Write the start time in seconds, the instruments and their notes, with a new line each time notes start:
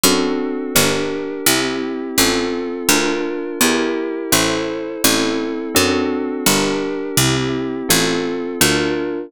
0.03 harpsichord F#2, electric piano 2 C4 D4 F#4 A4
0.75 harpsichord G1, electric piano 2 D4 G4 A#4
1.46 harpsichord C2, electric piano 2 C4 E4 G4
2.18 harpsichord A1, electric piano 2 C4 F4 A4
2.88 harpsichord D2, electric piano 2 D4 F4 A#4
3.61 harpsichord E2, electric piano 2 E4 G4 A#4
4.32 harpsichord A1, electric piano 2 E4 A4 C5
5.04 harpsichord A1, electric piano 2 C4 E4 A4
5.74 harpsichord F#2, electric piano 2 C4 D4 F#4 A4
6.46 harpsichord G1, electric piano 2 D4 G4 A#4
7.17 harpsichord C2, electric piano 2 C4 E4 G4
7.89 harpsichord A1, electric piano 2 C4 F4 A4
8.61 harpsichord D2, electric piano 2 D4 F4 A#4